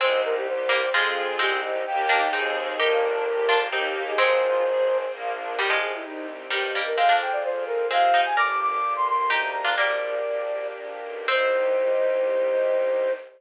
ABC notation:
X:1
M:3/4
L:1/16
Q:1/4=129
K:Cm
V:1 name="Flute"
c2 B G c4 A4 | G2 z2 g4 A2 z2 | B8 G3 A | c8 z4 |
G2 A _F E2 C2 G3 B | f2 g d c2 B2 f3 a | d' d' d'3 c' c' c' b2 b2 | "^rit." d8 z4 |
c12 |]
V:2 name="Harpsichord"
[A,C]6 [G,B,]2 [F,A,]4 | [A,C]6 [B,D]2 [CE]4 | [EG]6 [DF]2 [CE]4 | [A,C]6 z6 |
[E,G,] [F,A,]3 z4 [E,G,]2 [G,B,] z | [A,C] [B,D]3 z4 [A,C]2 [CE] z | [Bd]6 z2 [EG]3 [DF] | "^rit." [G,B,]4 z8 |
C12 |]
V:3 name="String Ensemble 1"
C2 E2 G2 C2 [CFA]4 | C2 E2 [B,EG]4 [CEA]4 | B,2 D2 G2 B,2 [B,EG]4 | C2 F2 A2 C2 B,2 D2 |
z12 | z12 | z12 | "^rit." z12 |
z12 |]
V:4 name="Violin" clef=bass
C,,8 F,,4 | C,,4 E,,4 E,,4 | G,,,8 E,,4 | A,,,8 B,,,4 |
C,,4 C,,4 G,,4 | F,,4 F,,4 C,4 | G,,,4 G,,,4 D,,4 | "^rit." B,,,4 B,,,4 B,,,2 =B,,,2 |
C,,12 |]
V:5 name="String Ensemble 1"
[CEG]4 [G,CG]4 [CFA]4 | [CEG]4 [B,EG]4 [CEA]4 | [B,DG]4 [G,B,G]4 [B,EG]4 | [CFA]4 [CAc]4 [B,DF]4 |
[CEG]12 | [CFA]12 | [B,DG]12 | "^rit." [B,DG]12 |
[CEG]12 |]